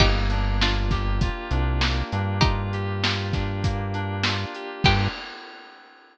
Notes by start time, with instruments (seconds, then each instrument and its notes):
0.00 synth bass 1 G1, electric piano 2 A#3, pizzicato strings D#4 G4, kick, crash
0.30 electric piano 2 D4, closed hi-hat
0.61 pizzicato strings D4 F4, electric piano 2 F4, snare
0.91 electric piano 2 G4, kick, snare, closed hi-hat
1.21 electric piano 2 F4, kick, closed hi-hat
1.51 synth bass 1 C2, electric piano 2 D4, closed hi-hat
1.81 electric piano 2 A#3, snare
2.12 synth bass 1 G2, electric piano 2 D4, closed hi-hat
2.41 pizzicato strings D#4 G4, electric piano 2 F4, kick, closed hi-hat
2.73 electric piano 2 G4, closed hi-hat
3.03 electric piano 2 F4, snare
3.33 electric piano 2 D4, kick, snare, closed hi-hat
3.64 electric piano 2 A#3, kick, closed hi-hat
3.94 electric piano 2 D4, closed hi-hat
4.23 electric piano 2 F4, snare
4.55 electric piano 2 G4, closed hi-hat
4.84 synth bass 1 G2, electric piano 2 A#3 D4 F4 G4, pizzicato strings G4, kick, crash